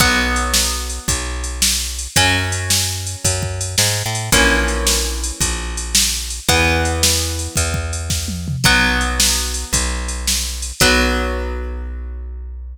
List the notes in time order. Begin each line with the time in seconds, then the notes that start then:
0.00 B1 F#3 B3, kick, crash
0.36 ride
0.54 snare
0.90 ride
1.08 B1, kick, ride
1.44 ride
1.62 snare
1.99 ride
2.16 F#2 F#3 C#4, kick, ride
2.52 ride
2.70 snare
3.07 ride
3.24 F#2, kick, ride
3.43 kick
3.61 ride
3.78 G#2, snare
4.06 A2
4.15 ride
4.32 A#1 E3 A#3 C#4, kick, ride
4.68 ride
4.87 snare
5.24 ride
5.40 A#1, kick, ride
5.77 ride
5.95 snare
6.30 ride
6.49 E2 E3 B3, kick, ride
6.85 ride
7.03 snare
7.39 ride
7.56 E2, kick, ride
7.74 kick
7.93 ride
8.10 kick, snare
8.28 high tom
8.48 mid tom
8.64 B1 F#3 B3, kick, crash
9.01 ride
9.20 snare
9.54 ride
9.73 B1, kick, ride
10.08 ride
10.27 snare
10.62 ride
10.80 B1 F#3 B3, kick, crash